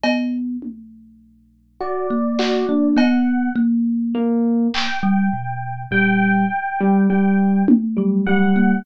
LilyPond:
<<
  \new Staff \with { instrumentName = "Electric Piano 1" } { \time 5/8 \tempo 4 = 51 r4. fis'16 r16 fis'16 d'16 | r4 ais8 r4 | g8 r16 g16 g8 r16 g16 g8 | }
  \new Staff \with { instrumentName = "Electric Piano 1" } { \time 5/8 r4. d''4 | fis''8 r4 g''4 | g''4 g''8 r8 fis''8 | }
  \new Staff \with { instrumentName = "Kalimba" } { \time 5/8 b8 r4 r16 ais8 ais16 | b8 ais4~ ais16 g16 b,8 | ais,8 r4 r16 fis8 ais16 | }
  \new DrumStaff \with { instrumentName = "Drums" } \drummode { \time 5/8 cb8 tommh4 r8 hc8 | cb4. hc4 | r4. tommh4 | }
>>